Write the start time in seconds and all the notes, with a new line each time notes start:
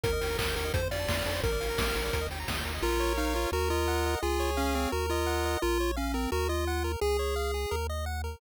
0.04 D#2 A#4, kick, closed hi-hat
0.13 D#5
0.21 D#2 G5, open hi-hat
0.30 A#5
0.38 D#2 A#4 D#6, kick, clap
0.48 G6
0.56 D#2 A#4, open hi-hat
0.65 D#5
0.73 F2 A4 C5, kick, closed hi-hat
0.83 C5
0.91 F2 D5 F5, open hi-hat
0.99 A5
1.08 F2 C6, kick, snare
1.17 F6
1.26 F2 A4, open hi-hat
1.35 C5
1.43 A#1 A#4, kick, closed hi-hat
1.52 D5
1.60 A#1 F5, open hi-hat
1.70 A#5
1.78 A#1 D6, kick, snare
1.87 F6
1.96 A#1 A#4, open hi-hat
2.04 D5
2.13 D#2 A#4, kick, closed hi-hat
2.21 D#5
2.30 D#2 G5, open hi-hat
2.40 A#5
2.48 D#2 D#6, kick, snare
2.56 G6
2.65 D#2 A#4, open hi-hat
2.74 D#5
2.82 A#1 F4 A#4
3.00 C#5
3.17 D#4 F5
3.35 F4 C#5
3.52 D#2 F#4 A#4
3.70 F4 D#5
3.88 F#5
4.06 D#5
4.22 C#2 F4 G#4
4.40 C#5
4.57 C#4 F5
4.75 C4 C#5
4.92 D#2 F#4 A#4
5.10 F4 D#5
5.27 F#5
5.45 D#5
5.62 A#1 F4 A#4
5.80 C#5
5.97 C#4 F5
6.14 C4 A#4
6.32 D#2 F#4 A#4
6.49 F4 D#5
6.67 F#5
6.84 A#4
7.01 C#2 G#4
7.19 C#5
7.36 F5
7.54 G#4
7.71 D#2 A#4
7.90 D#5
8.06 F#5
8.24 A#4